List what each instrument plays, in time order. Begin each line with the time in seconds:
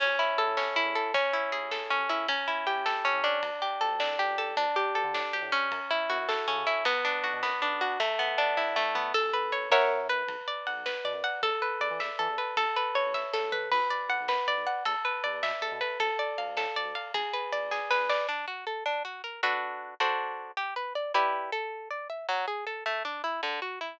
0.00 synth bass 2 A1, acoustic guitar (steel) C#4, kick, crash
0.19 acoustic guitar (steel) E4
0.38 synth bass 2 E2, acoustic guitar (steel) A4, ride
0.47 synth bass 2 A2
0.57 synth bass 2 A1, acoustic guitar (steel) C#4, snare
0.76 synth bass 2 A1, acoustic guitar (steel) E4
0.86 synth bass 2 E2
0.95 acoustic guitar (steel) A4, ride
1.14 synth bass 2 A1, acoustic guitar (steel) C#4, kick, ride
1.33 acoustic guitar (steel) E4
1.51 synth bass 2 A1, acoustic guitar (steel) G#4, ride
1.62 synth bass 2 A1
1.71 synth bass 2 A1, acoustic guitar (steel) A4, snare
1.90 synth bass 2 A1, acoustic guitar (steel) C#4
1.99 synth bass 2 A1
2.09 acoustic guitar (steel) E4, ride
2.27 synth bass 2 A1, acoustic guitar (steel) C#4, kick, ride
2.48 acoustic guitar (steel) E4
2.67 synth bass 2 A1, acoustic guitar (steel) G4, ride
2.76 synth bass 2 A1
2.85 synth bass 2 A1, acoustic guitar (steel) A4, snare
3.05 synth bass 2 A1, acoustic guitar (steel) C#4
3.14 synth bass 2 A2
3.24 acoustic guitar (steel) D4, ride
3.42 synth bass 2 D2, kick, ride
3.62 acoustic guitar (steel) G4
3.81 synth bass 2 D2, acoustic guitar (steel) A4, ride
3.92 synth bass 2 D2
4.00 synth bass 2 C2, acoustic guitar (steel) D4, snare
4.19 acoustic guitar (steel) G4
4.28 synth bass 2 C#2
4.38 acoustic guitar (steel) A4, ride
4.57 synth bass 2 D2, acoustic guitar (steel) D4, kick, ride
4.76 acoustic guitar (steel) G4
4.95 synth bass 2 D2, acoustic guitar (steel) A4, ride
5.04 synth bass 2 D3
5.13 synth bass 2 A2, acoustic guitar (steel) D4, snare
5.33 synth bass 2 D2, acoustic guitar (steel) G4
5.42 synth bass 2 A2
5.52 acoustic guitar (steel) C#4, ride
5.71 synth bass 2 F#2, kick, ride
5.91 acoustic guitar (steel) E4
6.10 synth bass 2 F#2, acoustic guitar (steel) F#4, ride
6.18 synth bass 2 F#2
6.28 synth bass 2 F#2, acoustic guitar (steel) A4, snare
6.47 synth bass 2 C#3, acoustic guitar (steel) C#4
6.56 synth bass 2 C#3
6.67 acoustic guitar (steel) E4, ride
6.85 synth bass 2 B1, acoustic guitar (steel) B3, kick, ride
7.05 acoustic guitar (steel) D4
7.23 synth bass 2 B1, acoustic guitar (steel) F#4, ride
7.33 synth bass 2 B2
7.42 synth bass 2 F#2, acoustic guitar (steel) B3, snare
7.61 synth bass 2 B1, acoustic guitar (steel) D4
7.72 synth bass 2 B1
7.81 acoustic guitar (steel) F#4, ride
8.00 acoustic guitar (steel) A3, kick, ride
8.19 acoustic guitar (steel) B3
8.38 acoustic guitar (steel) D4, ride
8.57 acoustic guitar (steel) E4, kick, snare
8.76 acoustic guitar (steel) A3, snare
8.95 acoustic guitar (steel) B3, floor tom
9.14 synth bass 2 A1, acoustic guitar (steel) A4, kick, crash
9.33 acoustic guitar (steel) B4
9.52 acoustic guitar (steel) C#5, ride
9.70 synth bass 2 F#2, acoustic guitar (steel) A#4 C#5 E5 F#5, snare
10.09 acoustic guitar (steel) B4, ride
10.27 synth bass 2 B1, kick, ride
10.41 kick
10.48 acoustic guitar (steel) D5
10.67 synth bass 2 B1, acoustic guitar (steel) F#5, ride
10.76 synth bass 2 B1
10.86 synth bass 2 B1, acoustic guitar (steel) B4, snare
11.04 synth bass 2 B2, acoustic guitar (steel) D5
11.13 synth bass 2 F#2
11.24 acoustic guitar (steel) F#5, ride
11.42 synth bass 2 E2, acoustic guitar (steel) A4, kick, ride
11.62 acoustic guitar (steel) B4
11.80 synth bass 2 E2, acoustic guitar (steel) D5, ride
11.91 synth bass 2 E3
12.00 synth bass 2 E2, acoustic guitar (steel) E5, snare
12.19 synth bass 2 E3, acoustic guitar (steel) A4
12.29 synth bass 2 E2
12.38 acoustic guitar (steel) B4, ride
12.57 synth bass 2 A1, acoustic guitar (steel) A4, kick, ride
12.76 acoustic guitar (steel) B4
12.95 synth bass 2 A1, acoustic guitar (steel) C#5, ride
13.06 synth bass 2 A1
13.14 synth bass 2 A1, acoustic guitar (steel) E5, kick, snare
13.33 synth bass 2 E2, acoustic guitar (steel) A4, snare
13.42 synth bass 2 A1
13.52 acoustic guitar (steel) B4, floor tom
13.72 synth bass 2 B1, acoustic guitar (steel) B4, kick, crash
13.90 acoustic guitar (steel) D5
14.09 synth bass 2 B1, acoustic guitar (steel) F#5, ride
14.21 synth bass 2 B1
14.28 synth bass 2 F#2, acoustic guitar (steel) B4, snare
14.47 synth bass 2 B1, acoustic guitar (steel) D5
14.58 synth bass 2 B1
14.67 acoustic guitar (steel) F#5, ride
14.85 synth bass 2 E2, acoustic guitar (steel) A4, kick, ride
15.05 acoustic guitar (steel) B4
15.24 synth bass 2 E2, acoustic guitar (steel) D5, ride
15.33 synth bass 2 E2
15.43 synth bass 2 B2, acoustic guitar (steel) E5, snare
15.61 synth bass 2 E2, acoustic guitar (steel) A4
15.72 synth bass 2 B2
15.81 acoustic guitar (steel) B4, ride
16.00 synth bass 2 D2, acoustic guitar (steel) A4, kick, ride
16.19 acoustic guitar (steel) D5
16.38 synth bass 2 D2, acoustic guitar (steel) F5, ride
16.48 synth bass 2 D2
16.57 synth bass 2 A2, acoustic guitar (steel) A4, snare
16.76 synth bass 2 D2, acoustic guitar (steel) D5
16.85 synth bass 2 D2
16.95 acoustic guitar (steel) F5, ride
17.14 synth bass 2 G#1, acoustic guitar (steel) G#4, kick, ride
17.33 acoustic guitar (steel) B4
17.52 synth bass 2 G#1, acoustic guitar (steel) D5, ride
17.63 synth bass 2 G#1
17.71 synth bass 2 G#1, acoustic guitar (steel) G#4, kick, snare
17.90 synth bass 2 G#1, acoustic guitar (steel) B4, snare
18.00 synth bass 2 G#1
18.09 acoustic guitar (steel) D5, snare
18.29 acoustic guitar (steel) D4
18.48 acoustic guitar (steel) F#4
18.67 acoustic guitar (steel) A4
18.86 acoustic guitar (steel) D4
19.05 acoustic guitar (steel) F#4
19.24 acoustic guitar (steel) A#4
19.43 acoustic guitar (steel) D4 F#4 A4 B4
20.00 acoustic guitar (steel) D4 F#4 A4 C5
20.57 acoustic guitar (steel) G4
20.76 acoustic guitar (steel) B4
20.95 acoustic guitar (steel) D5
21.14 acoustic guitar (steel) E4 G4 B4 D5
21.52 acoustic guitar (steel) A4
21.91 acoustic guitar (steel) D5
22.10 acoustic guitar (steel) E5
22.29 acoustic guitar (steel) F#3
22.48 acoustic guitar (steel) G#4
22.67 acoustic guitar (steel) A4
22.86 acoustic guitar (steel) A3
23.05 acoustic guitar (steel) D4
23.24 acoustic guitar (steel) E4
23.43 acoustic guitar (steel) D3
23.62 acoustic guitar (steel) F#4
23.81 acoustic guitar (steel) E4